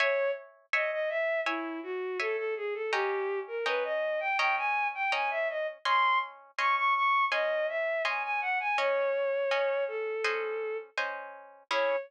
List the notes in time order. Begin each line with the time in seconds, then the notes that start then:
0.00 C#5 E5 G#5
0.73 C#5 D#5 E5 G#5
0.92 D#5
1.09 E5
1.45 E4 C#5 E5 G#5
1.83 F#4
2.20 A4 C#5 E5 G#5
2.37 A4
2.57 G#4
2.74 A4
2.92 C#4 G4 D#5 G5 A#5
3.48 A#4
3.66 C#4 B4 D#5 G5 A#5
3.85 D#5
4.20 G5
4.38 C#4 D#5 G5 A#5
4.57 G#5
4.95 G5
5.12 C#4 D#5 G5 G#5 A#5
5.30 E5
5.50 D#5
5.85 C#4 D#5 G#5 C6
6.58 C#4 D#5 G#5 C6 C#6
6.77 C#6
6.95 C#6
7.31 C#4 D#5 G#5 C6
7.69 E5
8.05 C#4 D#5 G#5 C6
8.23 G#5
8.41 F#5
8.60 G#5
8.78 C#4 C#5 D#5 G#5
9.51 C#4 D#5 G#5
9.88 A4
10.24 C#4 C5 D#5 G#5
10.98 C#4 C5 D#5 G#5
11.71 C#4 E4 G#4 C#5